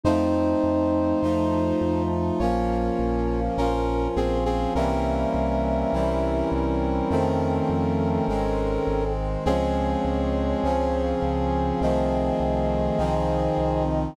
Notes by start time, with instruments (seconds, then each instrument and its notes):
0.03 synth bass 1 F2, brass section F3 A3 C4 D#4 C5, flute D#4
0.63 synth bass 1 F2
1.22 synth bass 1 F2, brass section F3 A3 D#4 F4
1.81 synth bass 1 F2
2.39 synth bass 1 A#1, brass section F3 A#3 C#4 F4 C#5, flute A#4
2.99 synth bass 1 A#1
3.58 synth bass 1 A#1, brass section F3 C#4 F4 A#4
4.16 synth bass 1 A#1, brass section C4 G#4
4.45 brass section C4 G#4
4.75 synth bass 1 C2, brass section E3 G3 A#3 C4 C#4 A#4, flute E5
5.34 synth bass 1 C2
5.93 synth bass 1 C2, brass section E3 G3 C4 E4
6.52 synth bass 1 C2
7.10 synth bass 1 F2, brass section D#3 F3 A3 C4, flute A4
7.69 synth bass 1 F2
8.28 synth bass 1 G#1, brass section D#3 G#3 C4
8.87 synth bass 1 G#1
9.46 synth bass 1 C#2, brass section F3 G#3 C4 C#4 G#4, flute C#5
10.05 synth bass 1 C#2
10.63 synth bass 1 C#2, brass section C#3 F3 C#4
11.22 synth bass 1 C#2
11.81 synth bass 1 C2, brass section D#3 F3 A3 C4, flute D#5
12.40 synth bass 1 C2
12.98 synth bass 1 C2, brass section D#3 F3 C4 D#4
13.58 synth bass 1 C2